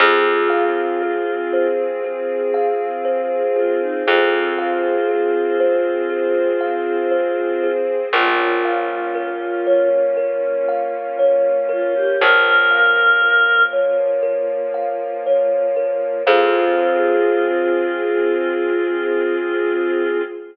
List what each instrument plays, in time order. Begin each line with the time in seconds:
0.00 electric bass (finger) F2, string ensemble 1 C4 F4 G#4, choir aahs F4, kalimba G#4
0.50 kalimba F5
1.02 kalimba G#4
1.53 kalimba C5
2.04 kalimba G#4
2.54 kalimba F5
3.05 kalimba C5
3.56 choir aahs F4, kalimba G#4
3.81 choir aahs D#4
4.07 electric bass (finger) F2, string ensemble 1 C4 G#4 C5, choir aahs F4, kalimba G#4
4.58 kalimba F5
5.09 kalimba G#4
5.60 kalimba C5
6.10 kalimba G#4
6.61 kalimba F5
7.11 kalimba C5
7.63 kalimba G#4
8.13 electric bass (finger) A#1, string ensemble 1 A#3 C#4 F4, choir aahs F4, kalimba A#4
8.65 kalimba F5
9.15 kalimba A#4
9.67 kalimba C#5
10.17 kalimba A#4
10.68 kalimba F5
11.19 kalimba C#5
11.69 choir aahs F4, kalimba A#4
11.95 choir aahs G4
12.20 electric bass (finger) A#1, string ensemble 1 F3 A#3 F4, choir aahs A#4, kalimba A#4
12.71 kalimba F5
13.22 kalimba A#4
13.73 kalimba C#5
14.23 kalimba A#4
14.74 kalimba F5
15.26 kalimba C#5
15.76 kalimba A#4
16.26 electric bass (finger) F2, string ensemble 1 C4 F4 G#4, choir aahs F4, kalimba G#4 C5 F5